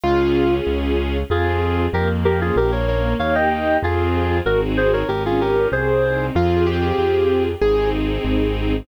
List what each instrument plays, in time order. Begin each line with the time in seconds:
0.03 acoustic grand piano C#2 F4, string ensemble 1 C#4 F4 G#4
0.67 acoustic grand piano C#2
1.30 acoustic grand piano F2, string ensemble 1 C4 F4 G#4, clarinet F4 G#4
1.93 acoustic grand piano F2, string ensemble 1 A#3, clarinet G4 A#4
2.24 string ensemble 1 C#4, clarinet G4 A#4
2.41 clarinet F4 G#4
2.56 acoustic grand piano A#1, string ensemble 1 A#3, clarinet G4 A#4
2.71 clarinet A#4 C#5
2.88 string ensemble 1 C#4, clarinet A#4 C#5
3.19 acoustic grand piano D#2, string ensemble 1 A#3 D#4 G4, clarinet C#5 F5
3.35 clarinet D#5 G5
3.51 clarinet D#5 G5
3.82 acoustic grand piano F2, string ensemble 1 C4 F4 G#4, clarinet F4 G#4
4.45 acoustic grand piano G#1, string ensemble 1 C4 D#4 F#4 G#4, clarinet F#4 A#4
4.77 clarinet G#4 C5
4.93 clarinet A#4 C#5
5.08 acoustic grand piano G#1, string ensemble 1 C#4, clarinet G4 A#4
5.25 clarinet F4 G#4
5.40 string ensemble 1 F4, clarinet G4 A#4
5.72 acoustic grand piano C2, string ensemble 1 C4, clarinet G#4 C5
6.03 string ensemble 1 D#4
6.35 acoustic grand piano F2 F4, string ensemble 1 C4 F4 G#4
6.67 acoustic grand piano G4
6.98 acoustic grand piano F2
7.61 acoustic grand piano G#1 G#4, string ensemble 1 C4 D#4 G#4
8.25 acoustic grand piano G#1